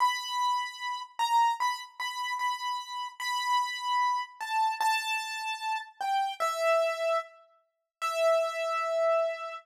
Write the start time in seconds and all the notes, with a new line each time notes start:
0.00 B5
1.19 A#5
1.60 B5
2.00 B5
2.39 B5
3.20 B5
4.41 A5
4.81 A5
6.01 G5
6.40 E5
8.02 E5